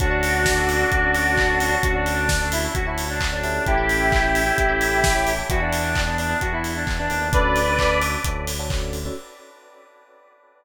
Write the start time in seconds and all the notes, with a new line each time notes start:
0.00 D2 C#4 D4 F#4 A4, kick, closed hi-hat
0.11 C#4 D4 F#4 A4
0.23 open hi-hat
0.46 kick, snare
0.58 C#4 D4 F#4 A4
0.69 open hi-hat
0.80 C#4 D4 F#4 A4
0.92 D2, kick, closed hi-hat
1.03 C#4 D4 F#4 A4
1.15 open hi-hat
1.37 kick, clap
1.50 C#4 D4 F#4 A4
1.59 C#4 D4 F#4 A4, open hi-hat
1.72 C#4 D4 F#4 A4
1.83 D2 C#4 D4 F#4 A4, kick, closed hi-hat
1.94 C#4 D4 F#4 A4
2.06 open hi-hat
2.29 kick, snare
2.40 C#4 D4 F#4 A4
2.52 E4, open hi-hat
2.64 C#4 D4 F#4 A4
2.75 D2 F#4, kick, closed hi-hat
2.86 C#4 D4 E4 F#4 A4
2.98 open hi-hat
3.09 D4
3.21 kick, clap
3.32 C#4 D4 F#4 A4
3.44 C#4 E4 G4 A4, open hi-hat
3.66 A1 E4 G4, kick, closed hi-hat
3.77 C#4 E4 G4 A4
3.89 open hi-hat
4.12 kick, clap
4.23 C#4 E4 G4 A4
4.35 open hi-hat
4.46 C#4 E4 G4 A4
4.58 A1, kick, closed hi-hat
4.69 C#4 E4 G4 A4
4.81 open hi-hat
5.04 kick, snare
5.15 C#4 E4 G4 A4
5.27 C#4 E4 G4 A4, open hi-hat
5.39 C#4 E4 G4 A4
5.50 E2 B3 D4 E4 F#4 G#4, kick, closed hi-hat
5.60 B3 D4 E4 G#4
5.73 open hi-hat
5.95 kick, clap
6.06 B3 D4 E4 G#4
6.18 D4, open hi-hat
6.30 B3 D4 E4 G#4
6.41 E2 F#4, kick, closed hi-hat
6.52 B3 D4 E4 G#4
6.64 open hi-hat
6.76 D4
6.87 E2, kick, clap
6.98 B3 D4 E4 G#4
7.10 D#2 B3 D4 E4 G#4, open hi-hat
7.21 B3 D4 E4 G#4
7.32 D2 C#4 D4 F#4 A4 B4 D5, kick, closed hi-hat
7.56 open hi-hat
7.67 C#4 D4 F#4 A4
7.79 C#4 D4 F#4 A4, kick, clap
8.01 C#4 D4 F#4 A4, open hi-hat
8.24 D2 C#4 D4 F#4 A4, kick, closed hi-hat
8.47 open hi-hat
8.59 C#4 D4 F#4 A4
8.70 C#4 D4 F#4 A4, kick, clap
8.93 open hi-hat
9.05 C#4 D4 F#4 A4